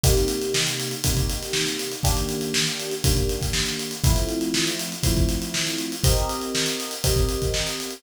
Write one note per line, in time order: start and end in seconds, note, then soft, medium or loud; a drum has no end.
0.04 0.94 C3 loud
0.04 0.94 A#3 loud
0.04 0.94 D#4 loud
0.04 0.94 G4 loud
0.04 kick loud
0.04 closed hi-hat loud
0.17 snare soft
0.17 closed hi-hat medium
0.28 closed hi-hat medium
0.42 closed hi-hat medium
0.54 snare loud
0.67 closed hi-hat medium
0.80 closed hi-hat medium
0.91 closed hi-hat medium
1.04 1.94 C3 medium
1.04 1.94 A#3 medium
1.04 1.94 D#4 medium
1.04 1.94 G4 medium
1.04 kick medium
1.04 closed hi-hat loud
1.17 kick medium
1.17 closed hi-hat medium
1.30 closed hi-hat medium
1.43 snare soft
1.43 closed hi-hat medium
1.53 snare loud
1.66 snare medium
1.66 closed hi-hat medium
1.78 snare soft
1.78 closed hi-hat medium
1.92 closed hi-hat medium
2.03 2.94 D#3 loud
2.03 2.94 A#3 loud
2.03 2.94 D4 loud
2.03 2.94 G4 loud
2.03 kick medium
2.03 closed hi-hat loud
2.17 closed hi-hat medium
2.29 closed hi-hat medium
2.41 closed hi-hat medium
2.54 snare loud
2.67 closed hi-hat medium
2.80 closed hi-hat medium
2.91 closed hi-hat medium
3.04 3.94 D#3 medium
3.04 3.94 A#3 medium
3.04 3.94 D4 medium
3.04 3.94 G4 medium
3.04 kick loud
3.04 closed hi-hat loud
3.17 kick medium
3.17 closed hi-hat medium
3.29 closed hi-hat medium
3.41 kick medium
3.41 snare soft
3.41 closed hi-hat medium
3.53 snare loud
3.66 snare medium
3.66 closed hi-hat medium
3.79 closed hi-hat medium
3.91 closed hi-hat medium
4.04 4.94 F3 loud
4.04 4.94 A3 loud
4.04 4.94 C4 medium
4.04 4.94 E4 loud
4.04 kick loud
4.04 closed hi-hat loud
4.16 closed hi-hat medium
4.29 closed hi-hat medium
4.41 closed hi-hat medium
4.54 snare loud
4.67 closed hi-hat medium
4.79 closed hi-hat medium
4.92 closed hi-hat medium
5.03 5.94 F3 medium
5.03 5.94 A3 medium
5.03 5.94 C4 medium
5.03 5.94 E4 medium
5.03 kick medium
5.03 closed hi-hat loud
5.17 kick medium
5.17 closed hi-hat medium
5.29 snare soft
5.29 closed hi-hat medium
5.42 closed hi-hat medium
5.54 snare loud
5.67 snare medium
5.67 closed hi-hat medium
5.79 closed hi-hat medium
5.92 closed hi-hat medium
6.04 6.94 C4 loud
6.04 6.94 G4 loud
6.04 6.94 A#4 loud
6.04 6.94 D#5 medium
6.04 kick loud
6.04 closed hi-hat loud
6.17 closed hi-hat medium
6.29 closed hi-hat medium
6.42 closed hi-hat medium
6.55 snare loud
6.66 closed hi-hat medium
6.80 closed hi-hat medium
6.91 closed hi-hat medium
7.04 7.94 C4 medium
7.04 7.94 G4 medium
7.04 7.94 A#4 medium
7.04 7.94 D#5 medium
7.04 kick medium
7.04 closed hi-hat loud
7.16 kick medium
7.16 closed hi-hat medium
7.29 closed hi-hat medium
7.42 kick medium
7.42 closed hi-hat medium
7.54 snare loud
7.67 snare medium
7.67 closed hi-hat medium
7.80 closed hi-hat medium
7.91 closed hi-hat medium